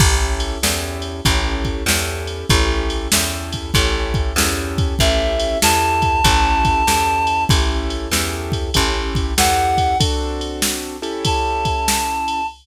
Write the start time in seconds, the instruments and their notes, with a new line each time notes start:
0.00 electric bass (finger) A1, acoustic grand piano C#4 E4 G4 A4, kick, crash
0.40 ride
0.62 electric bass (finger) E2, acoustic grand piano C#4 E4 G4 A4, snare
1.02 ride
1.25 electric bass (finger) A1, acoustic grand piano C#4 E4 G4 A4, kick, ride
1.65 kick, ride
1.86 electric bass (finger) E2, acoustic grand piano C#4 E4 G4 A4, snare
2.27 ride
2.49 electric bass (finger) A1, acoustic grand piano C#4 E4 G4 A4, kick, ride
2.90 ride
3.12 electric bass (finger) E2, acoustic grand piano C#4 E4 G4 A4, snare
3.52 kick, ride
3.74 electric bass (finger) A1, acoustic grand piano C#4 E4 G4 A4, kick, ride
4.14 kick, ride
4.36 electric bass (finger) E2, acoustic grand piano C#4 E4 G4 A4, snare
4.78 kick, ride
4.99 electric bass (finger) A1, acoustic grand piano C#4 E4 G4 A4, clarinet E5, kick, ride
5.39 ride
5.62 electric bass (finger) E2, acoustic grand piano C#4 E4 G4 A4, clarinet A5, snare
6.02 kick, ride
6.24 electric bass (finger) A1, acoustic grand piano C#4 E4 G4 A4, kick, ride
6.65 kick, ride
6.87 electric bass (finger) E2, acoustic grand piano C#4 E4 G4 A4, snare
7.27 ride
7.49 electric bass (finger) A1, acoustic grand piano C#4 E4 G4 A4, kick, ride
7.90 ride
8.11 electric bass (finger) E2, acoustic grand piano C#4 E4 G4 A4, snare
8.52 kick, ride
8.74 electric bass (finger) A1, acoustic grand piano C#4 E4 G4 A4, kick, ride
9.15 kick, ride
9.37 electric bass (finger) E2, acoustic grand piano C#4 E4 G4 A4, clarinet F#5, snare
9.78 kick, ride
10.00 acoustic grand piano C4 D4 F#4 A4, kick, ride
10.41 ride
10.62 snare
11.02 acoustic grand piano C#4 E4 G4 A4, ride
11.25 clarinet A5, kick, ride
11.65 kick, ride
11.88 snare
12.28 ride